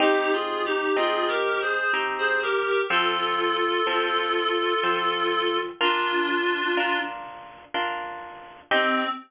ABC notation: X:1
M:3/4
L:1/16
Q:1/4=62
K:Cm
V:1 name="Clarinet"
(3[EG]2 [FA]2 [EG]2 (3[FA]2 [GB]2 [Ac]2 z [Ac] [GB]2 | [F=A]12 | [DF]6 z6 | C4 z8 |]
V:2 name="Orchestral Harp"
[CEG]4 [CEG]4 [CEG]4 | [F,C=A]4 [F,CA]4 [F,CA]4 | [DFB]4 [DFB]4 [DFB]4 | [CEG]4 z8 |]